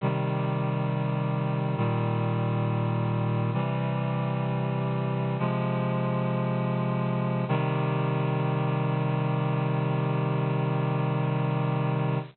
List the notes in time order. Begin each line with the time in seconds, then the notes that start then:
0.01 C3 D#3 G3
1.76 A#2 D#3 G3
3.53 C3 E3 G3
5.38 C3 F3 G#3
7.48 C3 D#3 G3